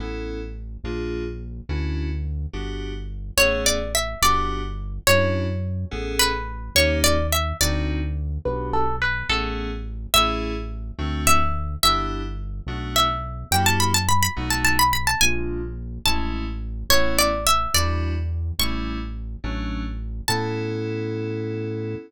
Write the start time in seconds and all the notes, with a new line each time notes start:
0.00 A1 B3 C#4 E4 A4
0.84 A#1 A#3 D4 F4 G#4
1.69 D2 C#4 D4 E4 F#4
2.53 G1 B3 D4 F#4 G4
3.37 A1 A3 B3 C#4 G#4 C#5
3.66 D5
3.95 E5
4.22 G1 B3 D4 F#4 G4 D5
5.07 F#2 C#4 D4 E4 F#4 C#5
5.91 A1 B3 C#4 G#4 A4
6.19 B4
6.75 D#2 A#3 C#4 D#4 G4 C#5
7.04 D5
7.32 E5
7.61 D2 C4 D4 D#4 F#4 D5
8.45 B1 B3 D4 F#4 G4 B4
8.73 A4
9.02 B4
9.29 A1 A3 B3 C#4 G#4 A4
10.14 A1 A3 C#4 E4 G#4 E5
10.98 D2 A3 C4 D4 F#4
11.27 E5
11.83 G1 B3 D4 E4 G4 E5
12.67 B1 A3 B3 D4 F#4
12.96 E5
13.51 F#2 A#3 E4 F#4 G4 G5
13.66 A5
13.80 B5
13.94 A5
14.09 B5
14.23 B5
14.37 B1 A3 B3 D#4 F#4
14.50 A5
14.65 A5
14.79 B5
14.93 B5
15.07 A5
15.21 A#1 G#3 A#3 D4 F4 G#5
16.05 A1 G#3 A3 C#4 E4 A5
16.90 A1 A3 B3 C#4 E4 C#5
17.19 D5
17.47 E5
17.74 E2 G3 D4 E4 F#4 D5
18.59 A1 G3 A3 C#4 E4 C#6
19.44 A1 F#3 A3 C#4 D4
20.28 A2 B3 C#4 E4 A4 A5